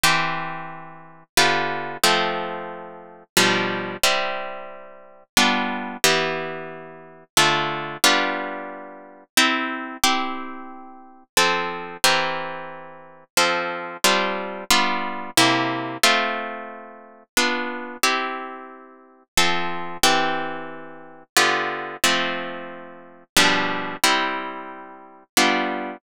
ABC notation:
X:1
M:3/4
L:1/8
Q:1/4=90
K:C
V:1 name="Acoustic Guitar (steel)"
[E,CG]4 [D,B,FG]2 | [F,A,C]4 [B,,F,G,D]2 | [G,CE]4 [G,B,DF]2 | [E,B,G]4 [D,A,F]2 |
[G,B,DF]4 [CEG]2 | [CEG]4 [F,CA]2 | [E,CG_B]4 [F,CA]2 | [G,CDF]2 [G,B,DF]2 [C,_B,EG]2 |
[A,CF]4 [B,DF]2 | [CEG]4 [F,CA]2 | [E,CG]4 [D,B,FG]2 | [F,A,C]4 [B,,F,G,D]2 |
[G,CE]4 [G,B,DF]2 |]